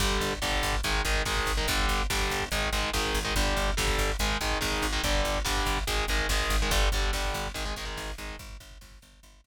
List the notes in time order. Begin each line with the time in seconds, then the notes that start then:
0.00 G1 D3 G3, kick, crash
0.11 kick
0.21 G1, kick, closed hi-hat
0.32 kick
0.42 G1 D3 G3, kick, snare
0.52 kick
0.63 G1, kick, closed hi-hat
0.73 kick
0.83 G#1 D#3 G#3, kick, closed hi-hat
0.94 kick
1.05 G#1 D#3 G#3, kick, closed hi-hat
1.15 kick
1.25 G#1 D#3 G#3, kick, snare
1.37 kick
1.46 G#1, kick, closed hi-hat
1.57 D#3 G#3, kick
1.68 G1 D3 G3, kick, closed hi-hat
1.79 kick
1.88 G1, kick, closed hi-hat
1.99 kick
2.10 G1 D3 G3, kick, snare
2.19 kick
2.30 G1, kick, closed hi-hat
2.40 kick
2.51 G#1 D#3 G#3, kick, closed hi-hat
2.63 kick
2.72 G#1 D#3 G#3, kick, closed hi-hat
2.83 kick
2.93 G#1 D#3 G#3, kick, snare
3.05 kick
3.14 G#1, kick, open hi-hat
3.25 D#3 G#3, kick
3.35 G1 D3 G3, kick, closed hi-hat
3.47 kick
3.57 G1, kick, closed hi-hat
3.68 kick
3.77 G1 D3 G3, kick, snare
3.87 kick
3.98 G1, kick, closed hi-hat
4.09 kick
4.19 G#1 D#3 G#3, kick, closed hi-hat
4.30 kick
4.41 G#1 D#3 G#3, kick, closed hi-hat
4.51 kick
4.61 G#1 D#3 G#3, kick, snare
4.72 kick
4.82 G#1, kick, closed hi-hat
4.93 D#3 G#3, kick
5.03 G1 D3 G3, kick, closed hi-hat
5.14 kick
5.25 G1, kick, closed hi-hat
5.35 kick
5.45 G1 D3 G3, kick, snare
5.57 kick
5.66 G1, kick, closed hi-hat
5.77 kick
5.87 G#1 D#3 G#3, kick, closed hi-hat
5.98 kick
6.08 G#1 D#3 G#3, kick, closed hi-hat
6.19 kick
6.29 G#1 D#3 G#3, kick, snare
6.40 kick
6.50 G#1, kick, closed hi-hat
6.61 D#3 G#3, kick
6.71 G1 D3 G3, kick, closed hi-hat
6.82 kick
6.92 G1 D3 G3, kick, closed hi-hat
7.03 kick
7.13 G1 D3 G3, kick, snare
7.25 kick
7.34 G1, kick, closed hi-hat
7.46 kick
7.54 G#1 D#3 G#3, kick, closed hi-hat
7.65 D#3 G#3, kick
7.76 G#1 D#3 G#3, kick, closed hi-hat
7.85 D#3 G#3, kick
7.97 G#1, kick, snare
8.08 kick
8.18 G#1 D#3 G#3, kick, closed hi-hat
8.29 kick
8.39 G1, kick, closed hi-hat
8.49 kick
8.60 G1, kick, closed hi-hat
8.71 kick
8.81 G1, kick, snare
8.91 kick
9.02 G1, kick, closed hi-hat
9.13 kick
9.23 G1, kick, closed hi-hat
9.33 kick
9.44 G1, kick, closed hi-hat